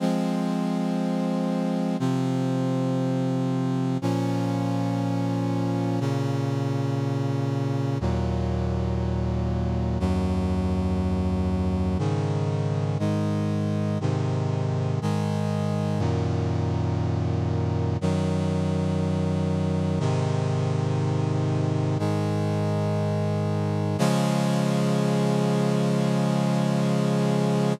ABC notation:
X:1
M:4/4
L:1/8
Q:1/4=60
K:Db
V:1 name="Brass Section"
[F,A,C]4 [C,F,C]4 | [B,,F,D]4 [B,,D,D]4 | [E,,B,,G,]4 [E,,G,,G,]4 | [A,,D,E,]2 [A,,E,A,]2 [A,,C,E,]2 [A,,E,A,]2 |
[G,,B,,E,]4 [G,,E,G,]4 | [A,,C,E,]4 [A,,E,A,]4 | [D,F,A,]8 |]